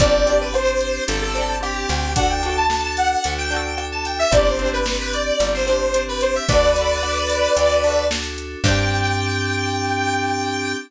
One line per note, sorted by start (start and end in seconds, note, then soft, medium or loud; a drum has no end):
0.00 0.99 G1 loud
0.00 0.25 C4 loud
0.00 0.49 C4 medium
0.00 0.49 D4 medium
0.00 0.25 D4 loud
0.00 0.49 G4 loud
0.00 0.38 D5 loud
0.00 kick loud
0.00 closed hi-hat loud
0.06 0.25 G4 loud
0.26 1.26 C4 loud
0.26 1.26 D4 medium
0.26 closed hi-hat medium
0.32 1.26 G4 loud
0.41 0.53 B4 medium
0.54 1.03 C4 medium
0.54 1.03 D4 medium
0.54 1.03 G4 medium
0.54 1.04 C5 loud
0.54 cross-stick loud
0.81 closed hi-hat medium
1.07 1.85 G1 medium
1.07 1.56 C4 medium
1.07 1.56 D4 medium
1.07 1.56 G4 medium
1.07 1.21 A4 medium
1.07 closed hi-hat loud
1.22 1.56 A4 loud
1.35 2.09 C4 loud
1.35 2.09 D4 loud
1.35 closed hi-hat medium
1.41 2.09 G4 loud
1.60 2.09 C4 medium
1.60 2.09 D4 medium
1.60 2.09 G4 medium
1.60 2.13 G4 medium
1.60 cross-stick loud
1.89 3.16 D2 medium
1.89 closed hi-hat medium
2.16 2.64 D4 medium
2.16 2.42 D4 loud
2.16 2.64 F#4 medium
2.16 2.64 A4 medium
2.16 2.29 F#5 loud
2.16 kick loud
2.16 closed hi-hat loud
2.20 2.42 F#4 loud
2.20 2.42 A4 loud
2.30 2.54 G5 medium
2.43 3.42 D4 loud
2.43 3.42 F#4 loud
2.43 closed hi-hat medium
2.49 3.42 A4 loud
2.57 2.81 A5 medium
2.70 3.19 D4 medium
2.70 3.19 F#4 medium
2.70 3.19 A4 medium
2.70 snare loud
2.84 2.97 A5 medium
2.97 3.33 F#5 medium
2.97 closed hi-hat medium
3.24 4.25 D2 medium
3.24 3.73 D4 medium
3.24 3.73 F#4 medium
3.24 3.73 A4 medium
3.24 closed hi-hat loud
3.38 3.51 G5 loud
3.50 4.25 D4 medium
3.50 4.25 F#4 loud
3.50 3.85 G5 medium
3.50 closed hi-hat medium
3.56 4.25 A4 loud
3.77 4.26 D4 medium
3.77 4.26 F#4 medium
3.77 4.26 A4 medium
3.77 cross-stick loud
3.92 4.05 A5 medium
4.05 4.18 G5 medium
4.05 closed hi-hat medium
4.19 4.32 E5 loud
4.31 5.31 G1 medium
4.31 4.56 C4 loud
4.31 4.81 C4 medium
4.31 4.81 D4 medium
4.31 4.56 D4 loud
4.31 4.81 G4 medium
4.31 4.45 D5 loud
4.31 kick loud
4.31 closed hi-hat loud
4.37 4.56 G4 loud
4.46 4.70 C5 medium
4.59 5.58 C4 loud
4.59 5.58 D4 loud
4.59 closed hi-hat medium
4.65 5.58 G4 loud
4.73 4.96 B4 medium
4.86 5.35 C4 medium
4.86 5.35 D4 medium
4.86 5.35 G4 medium
4.86 snare loud
5.00 5.13 B4 medium
5.13 5.48 D5 medium
5.13 closed hi-hat medium
5.39 6.39 G1 medium
5.39 5.88 C4 medium
5.39 5.88 D4 medium
5.39 5.88 G4 medium
5.39 closed hi-hat loud
5.54 5.67 C5 medium
5.67 6.41 C4 medium
5.67 6.41 D4 medium
5.67 6.02 C5 medium
5.67 closed hi-hat medium
5.73 6.41 G4 loud
5.94 6.43 C4 medium
5.94 6.43 D4 medium
5.94 6.43 G4 medium
5.94 closed hi-hat loud
6.08 6.21 B4 loud
6.21 6.34 C5 medium
6.21 closed hi-hat medium
6.35 6.48 E5 medium
6.48 7.48 D2 medium
6.48 6.97 D4 medium
6.48 6.74 D4 loud
6.48 6.97 F#4 medium
6.48 6.74 F#4 loud
6.48 6.97 A4 medium
6.48 8.05 B4 loud
6.48 8.05 D5 loud
6.48 kick loud
6.48 closed hi-hat loud
6.55 6.74 A4 loud
6.75 7.75 D4 medium
6.75 7.75 F#4 loud
6.75 closed hi-hat medium
6.81 7.75 A4 medium
7.03 7.52 D4 medium
7.03 7.52 F#4 medium
7.03 7.52 A4 medium
7.03 cross-stick loud
7.30 closed hi-hat medium
7.56 8.56 D2 medium
7.56 8.05 D4 medium
7.56 8.05 F#4 medium
7.56 8.05 A4 medium
7.56 closed hi-hat loud
7.84 8.59 D4 loud
7.84 8.59 F#4 medium
7.84 closed hi-hat medium
7.90 8.59 A4 loud
8.11 8.59 D4 medium
8.11 8.59 F#4 medium
8.11 8.59 A4 medium
8.11 snare loud
8.38 closed hi-hat medium
8.64 10.75 G2 loud
8.64 10.76 C4 loud
8.64 10.76 D4 loud
8.64 10.76 G4 loud
8.64 10.76 G5 loud
8.64 kick loud
8.64 crash loud
8.68 10.76 D4 loud
8.68 10.76 G4 loud